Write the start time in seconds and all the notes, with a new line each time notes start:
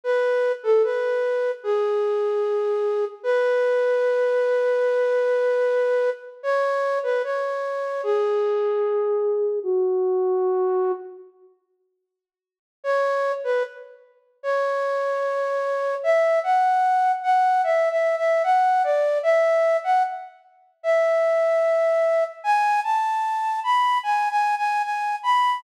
0.04 B4
0.63 A4
0.84 B4
1.64 G#4
3.23 B4
6.43 C#5
7.03 B4
7.24 C#5
8.03 G#4
9.63 F#4
12.84 C#5
13.44 B4
14.43 C#5
16.03 E5
16.44 F#5
17.23 F#5
17.64 E5
17.90 E5
18.17 E5
18.44 F#5
18.84 D5
19.23 E5
19.84 F#5
20.83 E5
22.44 G#5
22.84 A5
23.64 B5
24.03 G#5
24.30 G#5
24.57 G#5
24.83 G#5
25.23 B5